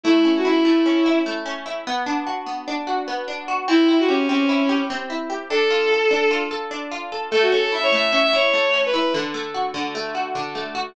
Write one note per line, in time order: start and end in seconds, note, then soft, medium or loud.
0.04 0.64 A3 loud
0.04 0.30 E4 loud
0.25 0.85 C#4 medium
0.37 0.47 F#4 medium
0.45 1.05 E4 medium
0.45 0.64 E4 loud
0.64 1.26 A3 medium
0.64 1.16 E4 loud
0.86 1.45 C#4 medium
1.06 1.65 E4 medium
1.26 1.84 A3 medium
1.46 1.84 C#4 medium
1.66 1.85 E4 medium
1.87 2.46 B3 loud
2.06 2.67 D4 medium
2.27 2.87 F#4 medium
2.46 3.07 B3 medium
2.68 3.27 D4 medium
2.87 3.48 F#4 medium
3.08 3.65 B3 medium
3.28 3.66 D4 medium
3.48 3.67 F#4 medium
3.68 4.29 C4 loud
3.68 3.97 E4 loud
3.89 4.49 E4 medium
3.99 4.09 F#4 loud
4.08 4.27 C#4 medium
4.08 4.69 G4 medium
4.29 4.90 C4 medium
4.29 4.78 C#4 loud
4.49 5.09 E4 medium
4.69 5.29 G4 medium
4.90 5.48 C4 medium
5.10 5.48 E4 medium
5.30 5.49 G4 medium
5.50 6.10 D4 loud
5.50 6.34 A4 loud
5.71 6.30 F4 medium
5.91 6.51 A4 medium
6.11 6.71 D4 medium
6.31 6.91 F4 medium
6.51 7.12 A4 medium
6.71 7.29 D4 medium
6.91 7.30 F4 medium
7.12 7.31 A4 medium
7.31 7.92 A3 medium
7.31 7.41 A4 loud
7.42 7.51 F#4 medium
7.52 8.12 C#4 medium
7.52 7.62 A4 loud
7.62 7.72 A4 loud
7.72 8.33 E4 medium
7.72 7.83 E5 medium
7.83 7.92 C#5 loud
7.92 8.53 A3 medium
7.92 8.10 E5 loud
8.10 8.73 C#4 medium
8.10 8.20 E5 loud
8.23 8.33 E5 loud
8.33 8.93 E4 medium
8.33 8.79 C#5 loud
8.53 9.11 A3 medium
8.74 9.12 C#4 medium
8.86 8.94 B4 loud
8.94 9.13 E4 medium
8.94 9.13 B4 loud
9.14 9.74 D3 loud
9.34 9.94 A3 medium
9.54 10.14 F#4 medium
9.74 10.35 D3 medium
9.95 10.55 A3 medium
10.15 10.74 F#4 medium
10.35 10.93 D3 medium
10.55 10.94 A3 medium
10.75 10.94 F#4 medium